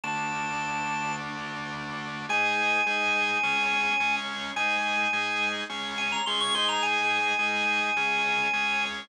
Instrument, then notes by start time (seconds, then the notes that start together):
drawbar organ
0.04 D3 A3 D4 A5
2.29 G#3 D#4 G#4 G#5
2.86 G#3 D#4 G#4
3.43 G#3 C#4 G#4
4.00 G#3 C#4 G#4
4.56 G#3 D#4 G#4 G#5
5.13 G#3 D#4 G#4
5.70 G#3 C#4 G#4
5.98 G#5
6.12 A#5
6.26 G#3 C#4 G#4 C6
6.40 C#6
6.54 G#3 D#4 G#4 C6
6.69 A#5
6.83 G#5
7.39 G#3 D#4 G#4
7.97 G#3 C#4 G#4
8.53 G#3 C#4 G#4